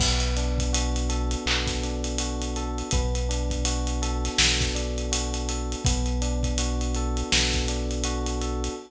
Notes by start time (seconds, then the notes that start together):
0.00 B1 B3, kick, crash
0.20 closed hi-hat
0.37 D4, closed hi-hat
0.58 kick, closed hi-hat
0.73 F#4, closed hi-hat
0.96 closed hi-hat
1.09 A4, closed hi-hat
1.31 closed hi-hat
1.46 B1 B3, clap
1.67 kick, snare, closed hi-hat
1.84 D4, closed hi-hat
2.04 closed hi-hat
2.18 F#4, closed hi-hat
2.42 closed hi-hat
2.56 A4, closed hi-hat
2.78 closed hi-hat
2.91 B1 B3, kick, closed hi-hat
3.15 closed hi-hat
3.29 D4, closed hi-hat
3.50 kick, closed hi-hat
3.65 F#4, closed hi-hat
3.87 closed hi-hat
4.02 A4, closed hi-hat
4.25 snare, closed hi-hat
4.38 B1 B3, snare
4.60 kick, snare, closed hi-hat
4.75 D4, closed hi-hat
4.98 closed hi-hat
5.12 F#4, closed hi-hat
5.34 closed hi-hat
5.49 A4, closed hi-hat
5.72 closed hi-hat
5.85 B1 B3, kick, closed hi-hat
6.06 closed hi-hat
6.22 D4, closed hi-hat
6.43 kick, closed hi-hat
6.58 F#4, closed hi-hat
6.81 closed hi-hat
6.95 A4, closed hi-hat
7.17 closed hi-hat
7.32 B1 B3, snare
7.53 kick, snare, closed hi-hat
7.68 D4, closed hi-hat
7.91 closed hi-hat
8.04 F#4, closed hi-hat
8.26 closed hi-hat
8.41 A4, closed hi-hat
8.64 closed hi-hat